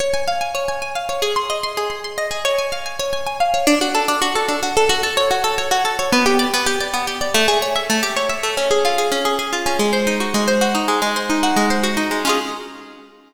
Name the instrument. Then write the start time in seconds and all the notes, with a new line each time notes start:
acoustic guitar (steel)
0.00 C#5
0.14 G#5
0.27 F5
0.41 G#5
0.55 C#5
0.68 G#5
0.82 G#5
0.95 F5
1.09 C#5
1.22 G#4
1.36 C6
1.50 D#5
1.63 C6
1.77 G#4
1.90 C6
2.04 C6
2.18 D#5
2.31 G#4
2.45 C#5
2.58 G#5
2.72 F5
2.86 G#5
2.99 C#5
3.13 G#5
3.26 G#5
3.40 F5
3.54 C#5
3.67 D4
3.81 F#4
3.95 A4
4.08 D4
4.22 F#4
4.35 A4
4.48 D4
4.63 F#4
4.77 A4
4.89 F#4
5.03 A4
5.17 C#5
5.31 F#4
5.44 A4
5.58 C#5
5.71 F#4
5.85 A4
5.99 C#5
6.12 B3
6.26 G4
6.39 D5
6.54 B3
6.66 G4
6.80 D5
6.94 B3
7.07 G4
7.21 D5
7.34 A3
7.48 G#4
7.62 C#5
7.76 E5
7.90 A3
8.03 G4
8.16 C#5
8.29 E5
8.43 A3
8.57 C#4
8.71 G#4
8.85 F4
8.98 G#4
9.12 C#4
9.25 G#4
9.39 G#4
9.53 F4
9.66 C#4
9.79 G#3
9.93 C5
10.07 D#4
10.20 F#4
10.34 G#3
10.48 C5
10.61 F#4
10.75 D#4
10.88 G#3
11.02 G#3
11.16 C5
11.30 D#4
11.43 F#4
11.56 G#3
11.70 C5
11.84 F#4
11.97 D#4
12.11 G#3
12.25 C#4 F4
12.29 G#4